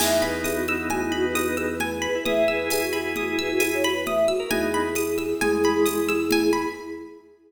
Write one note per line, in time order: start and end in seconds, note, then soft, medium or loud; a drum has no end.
0.00 2.08 E2 loud
0.00 1.75 B3 loud
0.00 1.75 D#4 loud
0.00 0.18 E5 medium
0.00 0.90 G#5 medium
0.00 crash loud
0.00 low conga medium
0.22 0.42 B4 medium
0.22 1.11 B5 medium
0.22 high conga medium
0.44 0.56 G#4 medium
0.44 1.35 D#6 medium
0.44 tambourine medium
0.44 high conga medium
0.55 0.66 F#4 medium
0.68 0.87 F#4 medium
0.68 1.57 E6 medium
0.68 high conga medium
0.90 1.01 F#4 medium
0.90 1.80 G#5 medium
0.90 low conga medium
1.02 1.12 E4 medium
1.12 1.25 F#4 medium
1.12 2.01 B5 medium
1.23 1.34 B4 loud
1.35 1.47 F#4 medium
1.35 2.25 D#6 medium
1.35 tambourine medium
1.35 high conga medium
1.46 1.57 B4 medium
1.56 1.67 G#4 loud
1.56 2.48 E6 medium
1.56 high conga medium
1.70 1.78 B4 medium
1.79 1.99 B4 medium
1.79 2.71 G#5 medium
1.79 low conga medium
2.02 2.24 B4 medium
2.02 2.92 B5 medium
2.15 2.26 E4 loud
2.25 4.33 E2 medium
2.25 3.82 E4 loud
2.25 3.82 G#4 loud
2.25 2.45 E5 loud
2.25 3.16 D#6 medium
2.25 low conga loud
2.48 2.68 B4 loud
2.48 3.38 E6 medium
2.70 2.80 G#4 medium
2.70 3.60 G#5 medium
2.70 tambourine loud
2.70 high conga medium
2.81 2.92 F#4 medium
2.93 3.14 F#4 medium
2.93 3.84 B5 medium
2.93 high conga medium
3.16 3.28 F#4 medium
3.16 4.06 D#6 medium
3.16 low conga medium
3.28 3.39 E4 medium
3.39 3.51 B4 medium
3.39 4.28 E6 medium
3.50 3.61 F#4 loud
3.59 3.70 E4 medium
3.59 4.46 G#5 medium
3.59 tambourine medium
3.59 high conga medium
3.74 3.85 C#5 medium
3.84 3.95 F#4 medium
3.84 4.49 B5 medium
3.84 high conga medium
3.94 4.04 B4 medium
4.06 4.26 E5 medium
4.06 4.50 D#6 medium
4.06 low conga medium
4.28 4.49 F#4 medium
4.28 4.50 E6 medium
4.40 4.50 A#4 loud
4.51 5.34 E2 loud
4.51 4.88 B3 loud
4.51 4.88 D#4 loud
4.51 6.51 E4 medium
4.51 6.51 G#4 loud
4.51 5.41 G#5 medium
4.51 low conga loud
4.74 5.64 B5 medium
4.95 5.85 D#6 medium
4.95 tambourine medium
4.95 high conga medium
5.18 6.08 E6 medium
5.18 high conga medium
5.41 6.66 E2 loud
5.41 6.20 G#3 loud
5.41 6.32 G#5 medium
5.41 low conga medium
5.64 6.52 B5 medium
5.64 high conga medium
5.86 6.71 D#6 medium
5.86 tambourine medium
5.86 high conga medium
6.09 6.73 E6 medium
6.09 high conga medium
6.31 6.75 G#5 medium
6.31 low conga loud
6.53 6.74 B5 medium